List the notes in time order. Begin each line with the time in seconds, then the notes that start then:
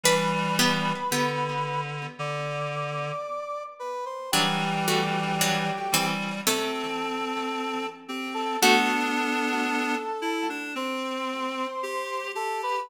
0.04 E3 G3 D4 B4 B5
0.59 B3 G4
1.11 D3 B3 G4
2.19 D3 D5 D6
3.79 B4 B5
4.06 C5 C6
4.32 E3 F#3 G3 D4 G4 G5
4.88 A3 F#4
5.41 F#3 D4
5.92 E3 G3 C4
6.47 C3 A3 C4 A4 A5
8.08 C4 G4 G5
8.34 A4 A5
8.62 A3 B3 D4 F#4 A4 A5
10.22 E4
10.50 D4
10.75 C4 C5 C6
11.83 G4
12.35 G4 A4 A5
12.63 B4 B5